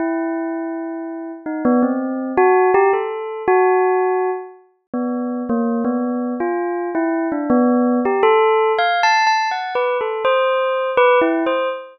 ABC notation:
X:1
M:2/4
L:1/16
Q:1/4=82
K:none
V:1 name="Tubular Bells"
E8 | _E B, C3 _G2 =G | A3 _G5 | z3 B,3 _B,2 |
B,3 F3 E2 | D B,3 G A3 | (3f2 a2 a2 (3_g2 B2 A2 | c4 (3B2 E2 c2 |]